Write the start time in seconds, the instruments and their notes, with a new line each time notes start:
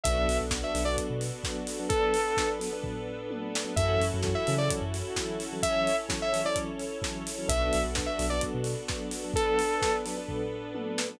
0.03 synth bass 2 B1, electric piano 1 F#3 B3 D4 A4, string ensemble 1 B3 D4 F#4 A4, lead 2 (sawtooth) E5, kick, closed hi-hat
0.28 synth bass 2 B1, open hi-hat
0.41 synth bass 2 B1
0.50 electric piano 1 F#3 B3 D4 A4, kick, snare
0.63 lead 2 (sawtooth) E5
0.74 synth bass 2 B1, electric piano 1 F#3 B3 D4 A4, open hi-hat
0.85 electric piano 1 F#3 B3 D4 A4, lead 2 (sawtooth) D5
0.97 kick, closed hi-hat
1.10 synth bass 2 B2
1.21 open hi-hat
1.44 electric piano 1 F#3 B3 D4 A4, kick, snare
1.67 open hi-hat
1.79 electric piano 1 F#3 B3 D4 A4
1.89 string ensemble 1 B3 D4 A4 B4, lead 2 (sawtooth) A4, kick, closed hi-hat
2.14 open hi-hat
2.37 electric piano 1 F#3 B3 D4 A4, kick, snare
2.59 electric piano 1 F#3 B3 D4 A4, open hi-hat
2.73 electric piano 1 F#3 B3 D4 A4
2.83 kick, floor tom
3.31 electric piano 1 F#3 B3 D4 A4, high tom
3.55 snare
3.65 electric piano 1 F#3 B3 D4 A4
3.76 synth bass 2 F#2, electric piano 1 E3 F#3 C#4 A4, string ensemble 1 C#4 E4 F#4 A4, lead 2 (sawtooth) E5, kick, closed hi-hat
4.00 synth bass 2 F#2, open hi-hat
4.14 synth bass 2 F#2
4.23 electric piano 1 E3 F#3 C#4 A4, kick, snare
4.35 lead 2 (sawtooth) E5
4.47 synth bass 2 C#3, electric piano 1 E3 F#3 C#4 A4, open hi-hat
4.58 electric piano 1 E3 F#3 C#4 A4, lead 2 (sawtooth) D5
4.70 kick, closed hi-hat
4.82 synth bass 2 F#2
4.94 open hi-hat
5.16 electric piano 1 E3 F#3 C#4 A4, kick, snare
5.40 open hi-hat
5.53 electric piano 1 E3 F#3 C#4 A4
5.62 string ensemble 1 C#4 E4 A4 C#5, lead 2 (sawtooth) E5, kick, closed hi-hat
5.87 open hi-hat
6.09 electric piano 1 E3 F#3 C#4 A4, kick, snare
6.22 lead 2 (sawtooth) E5
6.33 electric piano 1 E3 F#3 C#4 A4, open hi-hat
6.45 electric piano 1 E3 F#3 C#4 A4, lead 2 (sawtooth) D5
6.56 kick, closed hi-hat
6.79 open hi-hat
7.02 electric piano 1 E3 F#3 C#4 A4, kick, snare
7.27 open hi-hat
7.38 electric piano 1 E3 F#3 C#4 A4
7.48 synth bass 2 B1, electric piano 1 F#3 B3 D4 A4, string ensemble 1 B3 D4 F#4 A4, lead 2 (sawtooth) E5, kick, closed hi-hat
7.73 synth bass 2 B1, open hi-hat
7.84 synth bass 2 B1
7.95 electric piano 1 F#3 B3 D4 A4, kick, snare
8.06 lead 2 (sawtooth) E5
8.18 synth bass 2 B1, electric piano 1 F#3 B3 D4 A4, open hi-hat
8.30 electric piano 1 F#3 B3 D4 A4, lead 2 (sawtooth) D5
8.41 kick, closed hi-hat
8.54 synth bass 2 B2
8.64 open hi-hat
8.88 electric piano 1 F#3 B3 D4 A4, kick, snare
9.11 open hi-hat
9.24 electric piano 1 F#3 B3 D4 A4
9.34 string ensemble 1 B3 D4 A4 B4, lead 2 (sawtooth) A4, kick, closed hi-hat
9.59 open hi-hat
9.81 electric piano 1 F#3 B3 D4 A4, kick, snare
10.06 electric piano 1 F#3 B3 D4 A4, open hi-hat
10.17 electric piano 1 F#3 B3 D4 A4
10.28 kick, floor tom
10.74 electric piano 1 F#3 B3 D4 A4, high tom
10.98 snare
11.09 electric piano 1 F#3 B3 D4 A4